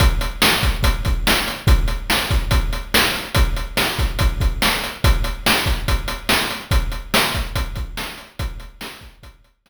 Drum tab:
HH |xx-xxx-x|xx-xxx-x|xx-xxx-x|xx-xxx-x|
SD |--o---o-|--o---o-|--o---o-|--o---o-|
BD |o--ooo--|o--oo---|o--ooo--|o--oo---|

HH |xx-xxx-x|xx-xxx--|
SD |--o---o-|--o---o-|
BD |o--ooo--|o--oo---|